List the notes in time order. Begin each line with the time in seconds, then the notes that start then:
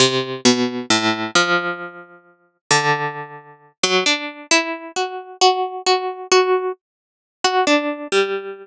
0.00 C3
0.45 B2
0.90 A2
1.35 F3
2.71 D3
3.83 F#3
4.06 D4
4.51 E4
4.96 F#4
5.41 F#4
5.86 F#4
6.32 F#4
7.44 F#4
7.67 D4
8.12 G3